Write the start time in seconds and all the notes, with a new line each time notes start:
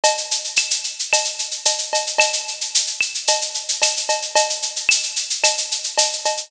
0.04 cowbell, shaker
0.18 shaker
0.31 shaker
0.44 shaker
0.56 claves, shaker
0.70 shaker
0.84 shaker
0.99 shaker
1.13 cowbell, claves, shaker
1.25 shaker
1.39 shaker
1.51 shaker
1.65 cowbell, shaker
1.78 shaker
1.93 cowbell, shaker
2.07 shaker
2.18 cowbell, claves, shaker
2.33 shaker
2.48 shaker
2.61 shaker
2.75 shaker
2.87 shaker
3.01 claves, shaker
3.15 shaker
3.27 cowbell, shaker
3.41 shaker
3.54 shaker
3.68 shaker
3.82 cowbell, claves, shaker
3.97 shaker
4.09 cowbell, shaker
4.22 shaker
4.35 cowbell, shaker
4.50 shaker
4.62 shaker
4.76 shaker
4.89 claves, shaker
5.03 shaker
5.16 shaker
5.30 shaker
5.44 cowbell, claves, shaker
5.58 shaker
5.71 shaker
5.84 shaker
5.98 cowbell, shaker
6.13 shaker
6.25 cowbell, shaker
6.37 shaker